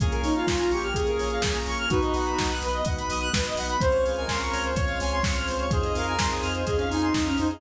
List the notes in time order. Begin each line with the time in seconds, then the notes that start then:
0.00 A#1 A#3 C#4 F4 G#4, kick, closed hi-hat
0.11 A#4, closed hi-hat
0.23 A#1 D#4 C#5, open hi-hat
0.35 F4 F5, closed hi-hat
0.47 A#1 A#3 C#4 F4 G#4 G#5, kick, snare
0.58 F4 A#5, closed hi-hat
0.71 A#1 G4 C#6, open hi-hat
0.83 F6, closed hi-hat
0.94 A#1 A#3 C#4 F4 G#4, kick, closed hi-hat
1.07 A#4, closed hi-hat
1.18 A#1 C#5, open hi-hat
1.30 F5, closed hi-hat
1.42 A#1 A#3 C#4 F4 G#4 G#5, kick, snare
1.55 A#5, closed hi-hat
1.66 A#1 C#6, open hi-hat
1.78 F6, closed hi-hat
1.89 B1 B3 D#4 F#4 B4, kick, closed hi-hat
2.02 D#5, closed hi-hat
2.14 B1 F#5, open hi-hat
2.26 B5, closed hi-hat
2.38 B1 B3 D#4 F#4 D#6, kick, snare
2.49 F#6, closed hi-hat
2.62 B1 B4, open hi-hat
2.73 D#5, closed hi-hat
2.85 B1 B3 D#4 F#4 F#5, kick, closed hi-hat
2.98 B5, closed hi-hat
3.10 B1 D#6, open hi-hat
3.21 F#6, closed hi-hat
3.33 B1 B3 D#4 F#4 B4, kick, snare
3.45 D#5, closed hi-hat
3.56 B1 F#5, open hi-hat
3.69 B5, closed hi-hat
3.81 C#2 C4 C#4 F4 G#4 C5, kick, closed hi-hat
3.92 C#5, closed hi-hat
4.04 C#2 G#4 F5, open hi-hat
4.16 A#4 G#5, closed hi-hat
4.28 C#2 C4 C#4 F4 G#4 A#4 C6, kick, snare
4.40 A#4 C#6, closed hi-hat
4.52 C#2 C#5 F6, open hi-hat
4.64 C5, closed hi-hat
4.75 C#2 C4 C#4 F4 G#4 C#5, kick, closed hi-hat
4.88 F5, closed hi-hat
5.00 C#2 G#5, open hi-hat
5.12 C6, closed hi-hat
5.23 C#2 C4 C#4 F4 G#4 C#6, kick, snare
5.36 F6, closed hi-hat
5.47 C#2 C5, open hi-hat
5.59 C#5, closed hi-hat
5.70 F2 C4 D#4 F4 G#4 C5, kick, closed hi-hat
5.83 D#5, closed hi-hat
5.95 F2 A#4 F5, open hi-hat
6.07 G#5, closed hi-hat
6.19 F2 C4 D#4 F4 G#4 C6, kick, snare
6.31 G#4 D#6, closed hi-hat
6.43 F2 F6, open hi-hat
6.55 C5, closed hi-hat
6.66 F2 C4 D#4 F4 G#4 D#5, kick, closed hi-hat
6.76 C#4 F5, closed hi-hat
6.90 F2 D#4 G#5, open hi-hat
7.02 C6, closed hi-hat
7.14 F2 C4 D#4 F4 G#4 D#6, kick, snare
7.25 C#4 F6, closed hi-hat
7.37 F2 D#4 C5, open hi-hat
7.50 G#4 D#5, closed hi-hat